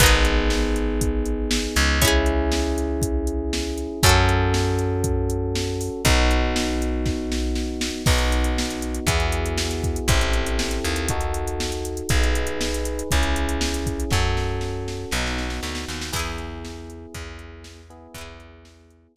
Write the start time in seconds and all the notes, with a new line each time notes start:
0.00 G#1 B3 D#4 G#4, kick, closed hi-hat
0.06 G#4
0.25 closed hi-hat
0.50 snare
0.76 closed hi-hat
1.01 kick, closed hi-hat
1.26 closed hi-hat
1.51 snare
1.76 C#2, closed hi-hat
2.01 C#4 E4 G#4, kick, closed hi-hat
2.08 G#4
2.26 closed hi-hat
2.52 snare
2.78 closed hi-hat
3.02 kick, closed hi-hat
3.27 closed hi-hat
3.53 snare
3.78 closed hi-hat
4.03 F#2 C#4 F#4 A4, kick, closed hi-hat
4.09 A4
4.29 closed hi-hat
4.54 snare
4.79 closed hi-hat
5.04 kick, closed hi-hat
5.30 closed hi-hat
5.55 snare
5.81 open hi-hat
6.05 B1 B3 D#4 F#4, kick, closed hi-hat
6.31 closed hi-hat
6.56 snare
6.82 closed hi-hat
7.06 kick, snare
7.32 snare
7.55 snare
7.81 snare
8.06 B1 B3 D#4 F#4, kick, crash
8.18 closed hi-hat
8.32 closed hi-hat
8.44 closed hi-hat
8.58 snare
8.70 closed hi-hat
8.82 closed hi-hat
8.95 closed hi-hat
9.07 E2 B3 E4 F#4 G#4, kick, closed hi-hat
9.20 closed hi-hat
9.32 closed hi-hat
9.46 closed hi-hat
9.58 snare
9.71 closed hi-hat
9.84 kick, closed hi-hat
9.96 closed hi-hat
10.08 A1 C4 E4 G4 A4, kick, closed hi-hat
10.21 closed hi-hat
10.33 closed hi-hat
10.47 closed hi-hat
10.59 snare
10.71 closed hi-hat
10.84 D#2, closed hi-hat
10.96 closed hi-hat
11.09 D#4 F#4 A4, kick, closed hi-hat
11.21 closed hi-hat
11.34 closed hi-hat
11.47 closed hi-hat
11.60 snare
11.72 closed hi-hat
11.85 closed hi-hat
11.97 closed hi-hat
12.09 B1 D#4 G#4 B4, kick, closed hi-hat
12.23 closed hi-hat
12.35 closed hi-hat
12.47 closed hi-hat
12.61 snare
12.74 closed hi-hat
12.85 closed hi-hat
12.99 closed hi-hat
13.11 C#2 C#4 E4 G#4, kick, closed hi-hat
13.23 closed hi-hat
13.36 closed hi-hat
13.49 closed hi-hat
13.61 snare
13.74 closed hi-hat
13.86 kick, closed hi-hat
14.00 closed hi-hat
14.11 F#2 C#4 F#4 A4, kick, snare
14.37 snare
14.61 snare
14.88 snare
15.11 B1 B3 D#4 F#4, snare
15.26 snare
15.38 snare
15.50 snare
15.63 D2, snare
15.75 snare
15.88 D#2, snare
16.01 snare
16.12 E2 B3 E4 G#4, kick, crash
16.19 G#4
16.38 closed hi-hat
16.65 snare
16.90 closed hi-hat
17.14 E2, kick, closed hi-hat
17.39 closed hi-hat
17.64 snare
17.90 B3 E4 G#4, closed hi-hat
18.14 E2 B3 E4, kick, closed hi-hat
18.21 G#4
18.40 closed hi-hat
18.65 snare
18.90 closed hi-hat
19.16 E2, kick